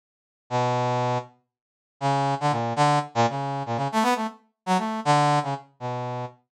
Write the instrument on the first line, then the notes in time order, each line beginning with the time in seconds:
brass section
0.50 B2
2.01 C#3
2.40 D3
2.51 A#2
2.76 D3
3.15 A#2
3.29 C#3
3.66 A#2
3.76 C#3
3.92 A3
4.03 B3
4.15 A3
4.66 F#3
4.78 A3
5.05 D3
5.43 C#3
5.80 B2